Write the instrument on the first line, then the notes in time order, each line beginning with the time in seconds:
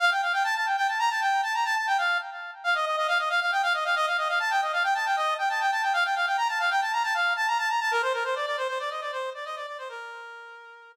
brass section
0.00 F5
0.11 G5
0.22 F5
0.33 G5
0.44 A5
0.55 A5
0.66 G5
0.77 G5
0.88 A5
0.99 A#5
1.10 A5
1.21 G5
1.43 A5
1.54 A#5
1.65 A5
1.76 A5
1.87 G5
1.98 F5
2.64 F5
2.75 D#5
2.86 D#5
2.97 D#5
3.08 F5
3.19 D#5
3.29 F5
3.41 F5
3.52 G5
3.63 F5
3.74 D#5
3.85 F5
3.96 D#5
4.07 F5
4.18 D#5
4.28 F5
4.40 A5
4.50 G5
4.62 D#5
4.73 F5
4.84 G5
4.95 A5
5.05 G5
5.16 D#5
5.38 G5
5.49 A5
5.61 G5
5.71 A5
5.82 G5
5.93 F5
6.04 G5
6.15 F5
6.26 G5
6.37 A#5
6.48 A5
6.59 F5
6.70 G5
6.81 A5
6.92 A#5
7.03 A5
7.14 F5
7.36 A5
7.47 A#5
7.58 A5
7.69 A#5
7.80 A5
7.91 A#4
8.02 C5
8.13 A#4
8.24 C5
8.35 D5
8.46 D5
8.57 C5
8.68 C5
8.79 D5
8.90 D#5
9.01 D5
9.12 C5
9.34 D5
9.45 D#5
9.56 D5
9.67 D5
9.78 C5
9.89 A#4